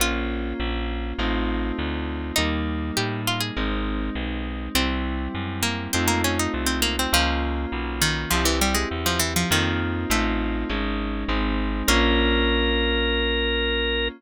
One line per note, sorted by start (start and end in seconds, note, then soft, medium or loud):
0.00 0.53 A#1 medium
0.00 1.16 A#3 medium
0.00 1.16 C#4 medium
0.00 1.16 F4 medium
0.00 2.17 F4 loud
0.60 1.13 A#1 medium
1.18 1.72 A1 medium
1.18 2.35 A3 medium
1.18 2.35 C4 medium
1.18 2.35 D#4 medium
1.18 2.35 F4 medium
1.78 2.32 D2 medium
2.36 2.91 D#2 medium
2.36 3.54 G3 medium
2.36 3.54 A#3 medium
2.36 2.89 D#4 loud
2.36 3.54 D#4 medium
2.97 3.51 A2 medium
2.97 3.21 G4 medium
3.27 3.41 F4 medium
3.40 3.83 G#4 medium
3.56 4.10 G#1 medium
3.56 4.73 G#3 medium
3.56 4.73 C4 medium
3.56 4.73 D#4 medium
4.15 4.69 B1 medium
4.75 5.28 C2 medium
4.75 5.92 G3 medium
4.75 5.54 C4 loud
4.75 5.92 C4 medium
4.75 5.92 E4 medium
5.35 5.88 F#2 medium
5.63 5.91 A#3 medium
5.93 6.48 F2 medium
5.93 7.11 A3 medium
5.93 6.07 C4 medium
5.93 7.11 C4 medium
5.93 7.11 D#4 medium
5.93 7.11 F4 medium
6.08 6.22 A#3 medium
6.24 6.38 C#4 medium
6.39 6.53 D#4 medium
6.54 7.07 C2 medium
6.66 6.81 C4 medium
6.82 6.96 A#3 medium
6.99 7.13 C4 medium
7.13 7.66 C#2 medium
7.13 7.95 F3 loud
7.13 8.29 A#3 medium
7.13 8.29 C#4 medium
7.13 8.29 F4 medium
7.72 8.26 B1 medium
8.01 8.30 D#3 medium
8.31 8.85 C2 medium
8.31 8.45 F3 medium
8.31 9.48 C4 medium
8.31 9.48 E4 medium
8.31 9.48 G4 medium
8.45 8.59 E3 medium
8.61 8.75 G3 medium
8.75 8.89 G#3 medium
8.91 9.45 E2 medium
9.06 9.20 F3 medium
9.19 9.34 E3 medium
9.36 9.50 F3 medium
9.50 10.05 F2 medium
9.50 10.01 D#3 medium
9.50 10.09 A#3 medium
9.50 10.09 C4 medium
9.50 10.09 D#4 medium
9.50 10.09 F4 medium
10.10 10.64 A1 medium
10.10 10.68 A3 medium
10.10 10.66 A3 medium
10.10 10.68 C4 medium
10.10 10.68 D#4 medium
10.10 10.68 F4 medium
10.69 11.25 G#1 medium
10.69 11.27 G#3 medium
10.69 11.27 C#4 medium
10.69 11.27 D#4 medium
11.28 11.83 G#1 medium
11.28 11.87 G#3 medium
11.28 11.87 C4 medium
11.28 11.87 D#4 medium
11.88 14.09 A#1 loud
11.88 14.09 A#3 loud
11.88 14.09 C#4 loud
11.88 14.09 F4 loud
11.88 14.08 A#4 loud